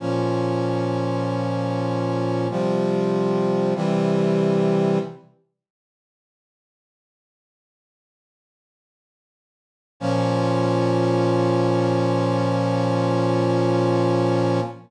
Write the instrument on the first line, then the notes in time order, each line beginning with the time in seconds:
brass section
0.00 A#2 F3 C#4
2.50 C3 F3 G3
3.75 C3 E3 G3
10.00 A#2 F3 C#4